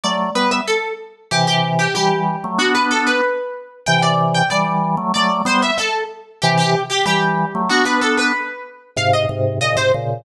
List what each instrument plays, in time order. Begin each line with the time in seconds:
0.04 drawbar organ F#3 A3, harpsichord D5
0.35 drawbar organ G3 B3, harpsichord B4
0.51 harpsichord E5
0.67 harpsichord A4
1.31 drawbar organ C3 E3, harpsichord G4
1.47 harpsichord G4
1.79 harpsichord G4
1.95 drawbar organ E3 G3, harpsichord G4
2.44 drawbar organ F#3 A3
2.58 drawbar organ B3 D4, harpsichord F#4
2.75 harpsichord B4
2.91 harpsichord A4
3.07 harpsichord B4
3.86 drawbar organ C3 E3, harpsichord G5
4.02 harpsichord D5
4.34 harpsichord G5
4.50 drawbar organ E3 G3, harpsichord D5
4.97 drawbar organ F#3 A3
5.14 drawbar organ F#3 A3, harpsichord D5
5.45 drawbar organ G3 B3, harpsichord C5
5.62 harpsichord E5
5.78 harpsichord A4
6.42 drawbar organ C3 E3, harpsichord G4
6.58 harpsichord G4
6.90 harpsichord G4
7.06 drawbar organ E3 G3, harpsichord G4
7.55 drawbar organ F#3 A3
7.69 drawbar organ B3 D4, harpsichord F#4
7.85 harpsichord B4
8.01 harpsichord A4
8.17 harpsichord B4
8.96 drawbar organ G#2 C3, harpsichord F5
9.13 harpsichord D#5
9.29 drawbar organ G#2 C3
9.61 drawbar organ A#2 C#3, harpsichord D#5
9.76 drawbar organ G#2 C3, harpsichord C5
9.94 drawbar organ A#2 C#3